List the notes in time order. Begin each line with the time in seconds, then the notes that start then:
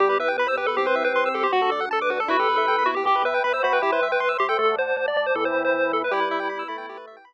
0.00 E2 G3 B3 E4 G4
0.09 B4
0.18 E2 B4 E5
0.28 G5
0.37 E2 B3 G4 B4 B5
0.47 C5 E6
0.57 E2 G4 B4
0.66 A4 B4
0.76 C2 C4 E4 G4
0.86 B4 C5
0.95 C2 E5
1.04 B4 G5
1.13 C2 C4 G4 C5 C6
1.26 E6
1.34 C2 G4 A4
1.43 G4 C5
1.52 D2 D4 F#4 A4
1.62 A4
1.70 D2 A4 D5
1.80 F#5
1.91 D2 D4 A4 D5 A5
2.01 B4 D6
2.09 D2 F#4 B4
2.20 A4
2.28 E2 E4 F#4 G4 B4
2.39 G4 A4
2.49 E2 B4
2.56 A4 E5
2.67 D2 B3 E4 B4 G5
2.78 B5
2.86 D#2 E4 F#4
2.95 G4
3.05 E2 G4 E5 G5 B5
3.16 B4
3.24 E2 B4 E5
3.34 G5
3.43 E2 B4 E5 B5
3.53 C5 E6
3.63 E2 F#4 C5 B5
3.73 B4 G5
3.82 C2 E4 G4 E5 G5 C6
3.92 B4 C5
4.02 C2 E5
4.12 B4 G5
4.20 C2 C5 E5 C6
4.29 E6
4.38 C2 G4 C6
4.49 A4 G5
4.57 D2 A3 A4 D5 F#5 A5
4.77 D2 C5
4.97 D2 C5 D5 A5 D6
5.08 D5
5.16 D2 D5
5.26 C5
5.35 E2 E3 A4 E5 G5 B5
5.45 C5
5.54 E2
5.65 C5
5.74 E2 B4 E5 B5
5.93 E2 A4
6.04 B4
6.11 G3 E4 G4 B4
6.20 B4
6.31 E5
6.40 G5
6.49 B3 E4 B4 B5
6.59 E6
6.68 A3 B5
6.78 G5
6.89 E4 G4 B4
6.97 B4
7.07 E5
7.17 G5
7.25 B3 E4 B4 B5